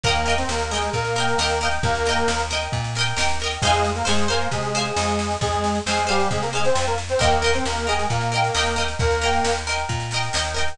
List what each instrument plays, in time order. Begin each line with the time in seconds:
0.04 electric bass (finger) D#2, accordion A#3 A#4, pizzicato strings A#4 D#5, kick, snare
0.08 pizzicato strings G5
0.15 snare
0.26 pizzicato strings A#4 D#5 G5, snare
0.38 accordion C4 C5, snare
0.49 electric bass (finger) D#2, accordion A#3 A#4, snare
0.60 snare
0.71 accordion G#3 G#4, pizzicato strings A#4 D#5, snare
0.75 pizzicato strings G5
0.82 snare
0.93 electric bass (finger) A#2, accordion A#3 A#4, kick, snare
1.04 snare
1.16 pizzicato strings A#4 D#5, snare
1.20 pizzicato strings G5
1.28 snare
1.38 electric bass (finger) D#2, pizzicato strings A#4 D#5, snare
1.43 pizzicato strings G5
1.50 snare
1.61 pizzicato strings A#4 D#5, snare
1.65 pizzicato strings G5
1.71 snare
1.83 electric bass (finger) D#2, accordion A#3 A#4, kick, snare
1.95 snare
2.06 pizzicato strings A#4 D#5, snare
2.11 pizzicato strings G5
2.17 snare
2.28 electric bass (finger) D#2, snare
2.39 snare
2.50 pizzicato strings A#4 D#5, snare
2.55 pizzicato strings G5
2.61 snare
2.72 electric bass (finger) A#2, kick, snare
2.84 snare
2.95 pizzicato strings A#4 D#5, snare
3.01 pizzicato strings G5
3.07 snare
3.17 electric bass (finger) D#2, pizzicato strings A#4 D#5, snare
3.21 pizzicato strings G5
3.29 snare
3.40 pizzicato strings A#4 D#5, snare
3.46 pizzicato strings G5
3.51 snare
3.62 electric bass (finger) F2, accordion G#3 G#4, pizzicato strings C5 F5, kick, snare, crash
3.67 pizzicato strings G#5
3.73 snare
3.84 snare
3.95 accordion A#3 A#4, snare
4.05 electric bass (finger) F2, accordion G#3 G#4, pizzicato strings C5 F5 G#5, snare
4.18 snare
4.28 accordion A#3 A#4, pizzicato strings C5 F5 G#5, snare
4.41 snare
4.51 electric bass (finger) C3, accordion G#3 G#4, kick, snare
4.63 snare
4.75 pizzicato strings C5 F5 G#5, snare
4.85 snare
4.96 electric bass (finger) F2, snare
5.08 snare
5.19 snare
5.31 snare
5.41 electric bass (finger) F2, accordion G#3 G#4, kick, snare
5.53 snare
5.64 snare
5.75 snare
5.86 electric bass (finger) F2, accordion G#3 G#4, pizzicato strings C5 F5, snare
5.91 pizzicato strings G#5
5.97 snare
6.07 accordion G3 G4, pizzicato strings C5 F5 G#5, snare
6.20 snare
6.31 electric bass (finger) C3, accordion G#3 G#4, kick, snare
6.42 accordion A#3 A#4, snare
6.53 accordion G#3 G#4, pizzicato strings C5 F5, snare
6.57 pizzicato strings G#5
6.64 accordion C4 C5, snare
6.75 electric bass (finger) F2, snare
6.86 accordion A#3 A#4, snare
6.98 snare
7.09 accordion C4 C5, snare
7.19 electric bass (finger) D#2, accordion A#3 A#4, pizzicato strings A#4 D#5 G5, kick, snare
7.32 snare
7.42 pizzicato strings A#4 D#5 G5, snare
7.53 accordion C4 C5, snare
7.65 electric bass (finger) D#2, accordion A#3 A#4, snare
7.77 snare
7.87 accordion G#3 G#4, pizzicato strings A#4 D#5, snare
7.91 pizzicato strings G5
7.99 snare
8.10 electric bass (finger) A#2, accordion A#3 A#4, kick, snare
8.21 snare
8.32 pizzicato strings A#4 D#5 G5, snare
8.44 snare
8.54 electric bass (finger) D#2, pizzicato strings A#4 D#5 G5, snare
8.66 snare
8.76 pizzicato strings A#4 D#5 G5, snare
8.88 snare
8.99 electric bass (finger) D#2, accordion A#3 A#4, kick, snare
9.11 snare
9.21 pizzicato strings A#4 D#5 G5, snare
9.33 snare
9.44 electric bass (finger) D#2, snare
9.56 snare
9.67 pizzicato strings A#4 D#5 G5, snare
9.77 snare
9.89 electric bass (finger) A#2, kick, snare
10.00 snare
10.11 pizzicato strings A#4 D#5, snare
10.16 pizzicato strings G5
10.23 snare
10.33 electric bass (finger) D#2, pizzicato strings A#4 D#5 G5, snare
10.45 snare
10.54 pizzicato strings A#4 D#5 G5, snare
10.68 snare